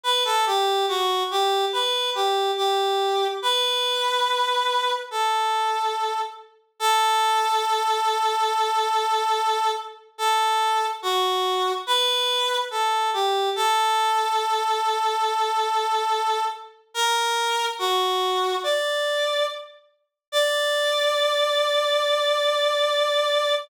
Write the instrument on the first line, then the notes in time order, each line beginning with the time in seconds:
clarinet
0.04 B4
0.25 A4
0.46 G4
0.88 F#4
1.31 G4
1.73 B4
2.15 G4
2.57 G4
3.42 B4
5.11 A4
6.80 A4
10.18 A4
11.02 F#4
11.87 B4
12.71 A4
13.14 G4
13.56 A4
16.94 A#4
17.79 F#4
18.63 D5
20.32 D5